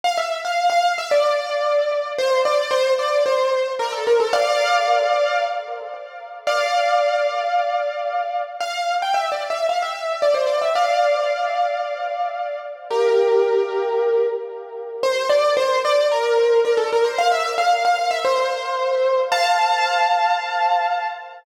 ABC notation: X:1
M:4/4
L:1/16
Q:1/4=112
K:F
V:1 name="Acoustic Grand Piano"
f e2 f2 f2 e d8 | c2 d2 c2 d2 c4 B A B A | [df]10 z6 | [df]16 |
f3 g (3e2 d2 e2 f e3 d c d e | [df]16 | [GB]12 z4 | c2 d2 c2 d2 B4 B A B c |
f e2 f2 f2 e c8 | [fa]16 |]